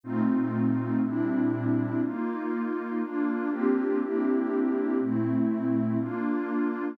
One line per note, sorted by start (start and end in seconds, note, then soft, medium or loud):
0.03 1.02 A#2 medium
0.03 1.02 A3 medium
0.03 1.02 C4 loud
0.03 1.02 D#4 medium
0.03 1.02 F4 medium
1.03 2.01 A#2 medium
1.03 2.01 G3 medium
1.03 2.01 C4 medium
1.03 2.01 D4 medium
1.03 2.01 E4 medium
2.02 3.00 A#3 medium
2.02 3.00 D#4 medium
2.02 3.00 F4 medium
3.01 3.50 A#3 medium
3.01 3.50 D4 medium
3.01 3.50 F4 medium
3.51 4.00 A#3 loud
3.51 4.00 C4 medium
3.51 4.00 D4 medium
3.51 4.00 F4 medium
3.51 4.00 G4 medium
4.00 4.98 A#3 medium
4.00 4.98 C4 medium
4.00 4.98 D4 medium
4.00 4.98 E4 medium
4.00 4.98 G4 medium
4.99 5.98 A#2 medium
4.99 5.98 A3 medium
4.99 5.98 C4 medium
4.99 5.98 E4 medium
5.99 6.97 A#3 loud
5.99 6.97 D4 medium
5.99 6.97 F4 medium